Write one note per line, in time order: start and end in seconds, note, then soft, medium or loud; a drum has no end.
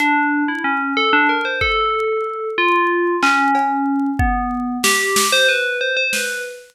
0.00 0.44 D4 loud
0.00 closed hi-hat medium
0.48 0.63 E4 medium
0.64 0.93 C#4 medium
0.97 1.11 A4 medium
1.13 1.27 D4 loud
1.29 1.44 A#4 medium
1.45 1.60 C5 medium
1.61 2.48 A4 medium
1.61 kick medium
2.58 3.16 F4 loud
3.23 4.10 C#4 loud
3.23 clap loud
3.55 cowbell loud
4.19 4.77 B3 medium
4.19 kick loud
4.84 5.27 G4 medium
4.84 snare loud
5.16 snare loud
5.32 5.47 C5 loud
5.49 5.78 B4 medium
5.81 5.95 C5 medium
5.97 6.11 C5 medium
6.13 6.42 B4 medium
6.13 snare medium